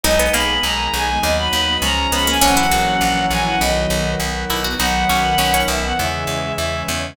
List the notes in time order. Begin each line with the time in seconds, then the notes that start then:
0.03 B1 G#3 B3 D#4 D#5
0.19 B3
0.32 B1 A#3 B5
0.63 B1 D#3 G#3 D#4 A#5
0.93 B1 G#5
1.22 D#2 F#3 B3 D#4 D#5
1.37 B5
1.53 D#2
1.82 C#2 F3 G#3 C#4 A#5
2.12 C#2 B3 B5
2.27 A#3 G#5
2.41 A#1 E3 F#3 A#3 C#4 F#5
2.57 E4
2.71 A#1 F#4
3.01 A#1 E3 F#3 C#4 E4
3.30 A#1 G#5
3.46 F#5
3.61 B1 D#3 F#3 B3 D#5
3.90 B1
4.20 B1 D#3 B3 D#4
4.50 B1 E4
4.64 F#4
4.79 B1 D#3 F#3 B3 D#4 F#5
5.09 B1 C#4
5.38 B1 D#3 B3 C#4 D#4
5.54 C#4
5.68 B1 E5
5.84 F#5
5.98 E2 C#3 E3 G#3 E5
6.27 E2
6.56 E2 C#3 G#3 C#4 E5
6.88 E2